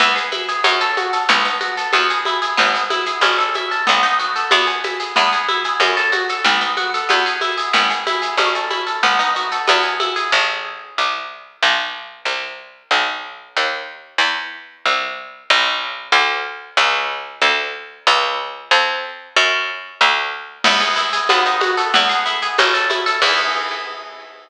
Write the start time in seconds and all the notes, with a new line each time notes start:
0.00 E2 B3, low conga, shaker
0.16 G#4, shaker
0.32 E4, high conga, shaker
0.48 G#4, shaker
0.64 F#2 C#4, high conga, shaker
0.81 A4, shaker
0.97 F#4, high conga, shaker
1.13 A4, shaker
1.29 B1 B3, low conga, shaker
1.45 D#4, shaker
1.61 F#4, high conga, shaker
1.77 A4, shaker
1.93 E2 B3, high conga, shaker
2.10 G#4, shaker
2.25 E4, high conga, shaker
2.42 G#4, shaker
2.57 G#1 B3, low conga, shaker
2.74 G#4, shaker
2.90 E4, high conga, shaker
3.06 G#4, shaker
3.21 A1 C#4, high conga, shaker
3.38 A4, shaker
3.54 E4, high conga, shaker
3.71 A4, shaker
3.87 B1 B3, low conga, shaker
4.03 D#4, shaker
4.19 F#4, shaker
4.36 A4, shaker
4.51 E2 B3, high conga, shaker
4.67 G#4, shaker
4.84 E4, high conga, shaker
5.00 G#4, shaker
5.16 E2 B3, low conga, shaker
5.32 G#4, shaker
5.48 E4, high conga, shaker
5.64 G#4, shaker
5.80 F#2 C#4, high conga, shaker
5.97 A4, shaker
6.12 F#4, high conga, shaker
6.29 A4, shaker
6.44 B1 B3, low conga, shaker
6.61 D#4, shaker
6.77 F#4, high conga, shaker
6.94 A4, shaker
7.09 E2 B3, high conga, shaker
7.26 G#4, shaker
7.41 E4, high conga, shaker
7.58 G#4, shaker
7.73 G#1 B3, low conga, shaker
7.90 G#4, shaker
8.07 E4, high conga, shaker
8.22 G#4, shaker
8.37 A1 C#4, high conga, shaker
8.55 A4, shaker
8.70 E4, high conga, shaker
8.87 A4, shaker
9.03 B1 B3, low conga, shaker
9.19 D#4, shaker
9.36 F#4, shaker
9.51 A4, shaker
9.67 E2 B3, high conga, shaker
9.83 G#4, shaker
10.00 E4, high conga, shaker
10.16 G#4, shaker
10.32 A1
10.98 C2
11.63 B1
12.25 C2
12.91 B1
13.57 D#2
14.18 E2
14.85 C2
15.50 B1
16.12 D2
16.77 C#2
17.42 D2
18.07 C#2
18.71 F2
19.36 F#2
20.01 D2
20.64 E2 B3, crash, low conga, shaker
20.81 G#4, shaker
20.96 E4, shaker
21.13 G#4, shaker
21.29 D#2 B3, high conga, shaker
21.45 D#4, shaker
21.61 F#4, high conga, shaker
21.77 A4, shaker
21.94 E2 B3, low conga, shaker
22.09 G#4, shaker
22.26 E4, shaker
22.42 G#4, shaker
22.58 A1 C#4, high conga, shaker
22.74 A4, shaker
22.90 E4, high conga, shaker
23.06 A4, shaker
23.22 E2 B3 E4 G#4, kick, crash